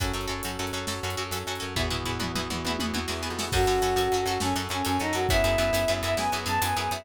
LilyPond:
<<
  \new Staff \with { instrumentName = "Choir Aahs" } { \time 12/8 \key fis \dorian \tempo 4. = 136 r1. | r1. | fis'2~ fis'8 fis'8 cis'8 r8 cis'8 cis'8 dis'8 fis'8 | e''2~ e''8 e''8 gis''8 r8 a''8 gis''8 gis''8 e''8 | }
  \new Staff \with { instrumentName = "Orchestral Harp" } { \time 12/8 \key fis \dorian <cis' fis' a'>8 <cis' fis' a'>8 <cis' fis' a'>8 <cis' fis' a'>8 <cis' fis' a'>8 <cis' fis' a'>8 <cis' fis' a'>8 <cis' fis' a'>8 <cis' fis' a'>8 <cis' fis' a'>8 <cis' fis' a'>8 <cis' fis' a'>8 | <b e' fis' gis'>8 <b e' fis' gis'>8 <b e' fis' gis'>8 <b e' fis' gis'>8 <b e' fis' gis'>8 <b e' fis' gis'>8 <b e' fis' gis'>8 <b e' fis' gis'>8 <b e' fis' gis'>8 <b e' fis' gis'>8 <b e' fis' gis'>8 <b e' fis' gis'>8 | <cis' fis' a'>8 <cis' fis' a'>8 <cis' fis' a'>8 <cis' fis' a'>8 <cis' fis' a'>8 <cis' fis' a'>8 <cis' fis' a'>8 <cis' fis' a'>8 <cis' fis' a'>8 <cis' fis' a'>8 <cis' fis' a'>8 <cis' fis' a'>8 | <b e' gis'>8 <b e' gis'>8 <b e' gis'>8 <b e' gis'>8 <b e' gis'>8 <b e' gis'>8 <b e' gis'>8 <b e' gis'>8 <b e' gis'>8 <b e' gis'>8 <b e' gis'>8 <b e' gis'>8 | }
  \new Staff \with { instrumentName = "Electric Bass (finger)" } { \clef bass \time 12/8 \key fis \dorian fis,8 fis,8 fis,8 fis,8 fis,8 fis,8 fis,8 fis,8 fis,8 fis,8 fis,8 fis,8 | e,8 e,8 e,8 e,8 e,8 e,8 e,8 e,8 e,8 e,8. eis,8. | fis,8 fis,8 fis,8 fis,8 fis,8 fis,8 fis,8 fis,8 fis,8 fis,8 fis,8 fis,8 | fis,8 fis,8 fis,8 fis,8 fis,8 fis,8 fis,8 fis,8 fis,8 fis,8 fis,8 fis,8 | }
  \new Staff \with { instrumentName = "Brass Section" } { \time 12/8 \key fis \dorian <cis' fis' a'>1. | <b e' fis' gis'>1. | <cis' fis' a'>2. <cis' a' cis''>2. | <b e' gis'>2. <b gis' b'>2. | }
  \new DrumStaff \with { instrumentName = "Drums" } \drummode { \time 12/8 <hh bd>8. hh8. hh8. hh8. sn8. hh8. hh8. hh8. | <bd tomfh>8 tomfh8 tomfh8 toml8 toml8 toml8 tommh8 tommh8 tommh8 sn4 sn8 | <cymc bd>8 hh8 hh8 hh8 hh8 hh8 sn8 hh8 hh8 hh8 hh8 hh8 | <hh bd>8 hh8 hh8 hh8 hh8 hh8 sn8 hh8 hh8 hh8 hh8 hh8 | }
>>